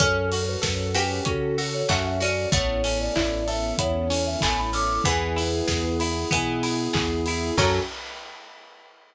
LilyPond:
<<
  \new Staff \with { instrumentName = "Ocarina" } { \time 4/4 \key fis \minor \tempo 4 = 95 a'8. b'8. b'8 a'8. cis''16 e''16 e''16 d''8 | cis''8. d''8. e''8 cis''8. e''16 gis''16 b''16 d'''8 | <gis' b'>4. r2 r8 | fis'4 r2. | }
  \new Staff \with { instrumentName = "Harpsichord" } { \time 4/4 \key fis \minor cis'4. g'4. fis'8 cis'8 | a2. a4 | e2 e4. r8 | fis4 r2. | }
  \new Staff \with { instrumentName = "Electric Piano 2" } { \time 4/4 \key fis \minor cis'8 fis'8 a'8 cis'8 fis'8 a'8 cis'8 fis'8 | b8 cis'8 e'8 a'8 b8 cis'8 e'8 a'8 | b8 e'8 gis'8 e'8 b8 e'8 gis'8 e'8 | <cis' fis' a'>4 r2. | }
  \new Staff \with { instrumentName = "Acoustic Guitar (steel)" } { \time 4/4 \key fis \minor cis'8 fis'8 a'8 fis'8 cis'8 fis'8 a'8 fis'8 | b8 cis'8 e'8 a'8 e'8 cis'8 b8 cis'8 | b8 e'8 gis'8 e'8 b8 e'8 gis'8 e'8 | <cis' fis' a'>4 r2. | }
  \new Staff \with { instrumentName = "Synth Bass 1" } { \clef bass \time 4/4 \key fis \minor fis,4 fis,4 cis4 fis,4 | a,,4 a,,4 e,4 a,,4 | e,4 e,4 b,4 e,4 | fis,4 r2. | }
  \new Staff \with { instrumentName = "String Ensemble 1" } { \time 4/4 \key fis \minor <cis' fis' a'>1 | <b cis' e' a'>1 | <b e' gis'>1 | <cis' fis' a'>4 r2. | }
  \new DrumStaff \with { instrumentName = "Drums" } \drummode { \time 4/4 <hh bd>8 hho8 <bd sn>8 hho8 <hh bd>8 hho8 <hc bd>8 hho8 | <hh bd>8 hho8 <hc bd>8 hho8 <hh bd>8 hho8 <hc bd>8 hho8 | <hh bd>8 hho8 <bd sn>8 hho8 <hh bd>8 hho8 <hc bd>8 hho8 | <cymc bd>4 r4 r4 r4 | }
>>